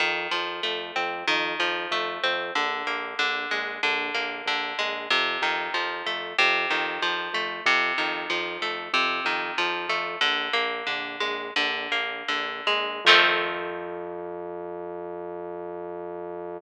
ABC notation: X:1
M:4/4
L:1/8
Q:1/4=94
K:Fmix
V:1 name="Acoustic Guitar (steel)"
E, F, A, C E, F, A, C | D, B, D, _A, D, B, D, A, | C, E, F, A, C, E, F, A, | C, E, F, A, C, E, F, A, |
"^rit." D, B, D, _A, D, B, D, A, | [E,F,A,C]8 |]
V:2 name="Synth Bass 1" clef=bass
F,, F,, F,, F,, F,, F,, F,, F,, | B,,, B,,, B,,, B,,, B,,, B,,, B,,, B,,, | F,, F,, F,, F,, F,, F,, F,, F,, | F,, F,, F,, F,, F,, F,, F,, F,, |
"^rit." B,,, B,,, B,,, B,,, B,,, B,,, B,,, B,,, | F,,8 |]